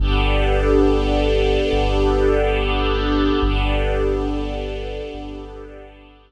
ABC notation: X:1
M:4/4
L:1/8
Q:1/4=70
K:Gmix
V:1 name="String Ensemble 1"
[B,DGA]8 | [B,DGA]8 |]
V:2 name="Synth Bass 2" clef=bass
G,,,4 G,,,4 | G,,,4 G,,,4 |]